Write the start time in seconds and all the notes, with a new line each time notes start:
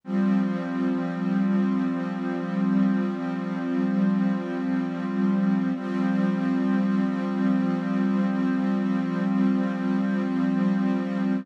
0.04 F3 G3 C4
5.75 F3 G3 C4